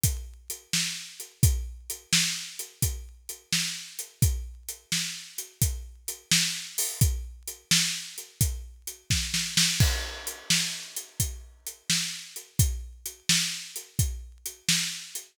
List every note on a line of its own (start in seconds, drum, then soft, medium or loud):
0.03 kick medium
0.03 closed hi-hat loud
0.50 closed hi-hat medium
0.73 snare medium
1.20 closed hi-hat medium
1.43 kick loud
1.43 closed hi-hat medium
1.90 closed hi-hat medium
2.13 snare loud
2.59 closed hi-hat medium
2.82 kick medium
2.82 closed hi-hat medium
3.29 closed hi-hat medium
3.52 snare medium
3.99 closed hi-hat medium
4.22 kick loud
4.22 closed hi-hat medium
4.68 closed hi-hat medium
4.92 snare medium
5.38 closed hi-hat medium
5.61 kick medium
5.61 closed hi-hat medium
6.08 closed hi-hat medium
6.31 snare loud
6.78 open hi-hat medium
7.01 kick loud
7.01 closed hi-hat medium
7.48 closed hi-hat medium
7.71 snare loud
8.18 closed hi-hat medium
8.41 kick medium
8.41 closed hi-hat medium
8.87 closed hi-hat medium
9.10 kick medium
9.10 snare medium
9.34 snare medium
9.57 snare loud
9.80 kick loud
9.80 crash medium
10.27 closed hi-hat medium
10.50 snare loud
10.96 closed hi-hat medium
11.20 kick medium
11.20 closed hi-hat medium
11.67 closed hi-hat medium
11.90 snare medium
12.36 closed hi-hat medium
12.59 kick loud
12.59 closed hi-hat loud
13.06 closed hi-hat medium
13.29 snare loud
13.76 closed hi-hat medium
13.99 kick medium
13.99 closed hi-hat medium
14.46 closed hi-hat medium
14.68 snare loud
15.15 closed hi-hat medium